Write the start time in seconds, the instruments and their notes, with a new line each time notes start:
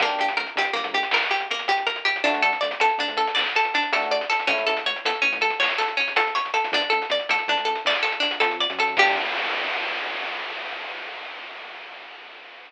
0.00 synth bass 1 G1, electric piano 1 A#3 D4, harpsichord A#3, kick, closed hi-hat
0.04 electric piano 1 G4
0.09 closed hi-hat
0.19 synth bass 1 G1, harpsichord G4, closed hi-hat
0.28 closed hi-hat
0.36 synth bass 1 D2, harpsichord A#4, closed hi-hat
0.47 closed hi-hat
0.55 synth bass 1 D2, harpsichord G4, closed hi-hat
0.65 closed hi-hat
0.73 synth bass 1 G1, harpsichord A#3, closed hi-hat
0.84 synth bass 1 G1, closed hi-hat
0.93 synth bass 1 D2, harpsichord G4, closed hi-hat
1.03 closed hi-hat
1.11 synth bass 1 G1, harpsichord A#4, clap
1.22 closed hi-hat
1.31 harpsichord G4, closed hi-hat
1.40 closed hi-hat
1.51 harpsichord A#3, closed hi-hat
1.59 closed hi-hat
1.68 harpsichord G4, closed hi-hat
1.77 closed hi-hat
1.87 harpsichord A#4, closed hi-hat
1.96 closed hi-hat
2.05 harpsichord G4, closed hi-hat
2.16 closed hi-hat
2.24 synth bass 1 D2, electric piano 1 A3 D4, harpsichord D4, kick, closed hi-hat
2.29 electric piano 1 F#4
2.34 closed hi-hat
2.42 synth bass 1 D3, harpsichord A4, closed hi-hat
2.53 closed hi-hat
2.61 synth bass 1 D2, harpsichord D5, closed hi-hat
2.71 closed hi-hat
2.80 synth bass 1 D2, harpsichord A4, closed hi-hat
2.89 closed hi-hat
2.98 synth bass 1 D2, harpsichord D4, closed hi-hat
3.08 synth bass 1 D2, closed hi-hat
3.17 synth bass 1 D2, harpsichord A4, closed hi-hat
3.27 closed hi-hat
3.35 synth bass 1 D2, harpsichord D5, clap
3.46 closed hi-hat
3.55 harpsichord A4, closed hi-hat
3.65 closed hi-hat
3.74 harpsichord D4, closed hi-hat
3.82 closed hi-hat
3.92 electric piano 1 A3 D4, harpsichord A4, closed hi-hat
3.97 electric piano 1 F#4
4.02 closed hi-hat
4.11 harpsichord D5, closed hi-hat
4.21 closed hi-hat
4.30 harpsichord A4, closed hi-hat
4.40 closed hi-hat
4.47 synth bass 1 A1, electric piano 1 A3 C#4, harpsichord C#4, kick, closed hi-hat
4.53 electric piano 1 E4
4.58 closed hi-hat
4.67 synth bass 1 A1, harpsichord A4, closed hi-hat
4.77 closed hi-hat
4.86 synth bass 1 A1, harpsichord C#5, closed hi-hat
4.96 closed hi-hat
5.05 synth bass 1 E2, harpsichord A4, closed hi-hat
5.15 closed hi-hat
5.22 synth bass 1 A1, harpsichord C#4, closed hi-hat
5.33 synth bass 1 A1, closed hi-hat
5.41 synth bass 1 A1, harpsichord A4, closed hi-hat
5.50 closed hi-hat
5.59 synth bass 1 A1, harpsichord C#5, clap
5.69 closed hi-hat
5.78 harpsichord A4, closed hi-hat
5.88 closed hi-hat
5.97 harpsichord C#4, closed hi-hat
6.08 closed hi-hat
6.16 harpsichord A4, closed hi-hat
6.27 closed hi-hat
6.35 harpsichord C#5, closed hi-hat
6.45 closed hi-hat
6.54 harpsichord A4, closed hi-hat
6.64 closed hi-hat
6.72 synth bass 1 D2, harpsichord D4, kick, closed hi-hat
6.81 closed hi-hat
6.90 synth bass 1 D2, harpsichord A4, closed hi-hat
7.02 closed hi-hat
7.10 synth bass 1 D2, harpsichord D5, closed hi-hat
7.19 closed hi-hat
7.29 synth bass 1 A2, harpsichord A4, closed hi-hat
7.39 closed hi-hat
7.48 synth bass 1 A2, harpsichord D4, closed hi-hat
7.56 synth bass 1 D2, closed hi-hat
7.65 synth bass 1 D2, harpsichord A4, closed hi-hat
7.75 closed hi-hat
7.85 synth bass 1 D2, harpsichord D5, clap
7.95 closed hi-hat
8.03 harpsichord A4, closed hi-hat
8.12 closed hi-hat
8.20 harpsichord D4, closed hi-hat
8.31 closed hi-hat
8.40 synth bass 1 F2, harpsichord A4, closed hi-hat
8.51 closed hi-hat
8.60 harpsichord D5, closed hi-hat
8.70 synth bass 1 F#2, closed hi-hat
8.79 harpsichord A4, closed hi-hat
8.88 closed hi-hat
8.97 synth bass 1 G2, electric piano 1 A#3 D4, harpsichord G4, kick, crash
9.02 electric piano 1 G4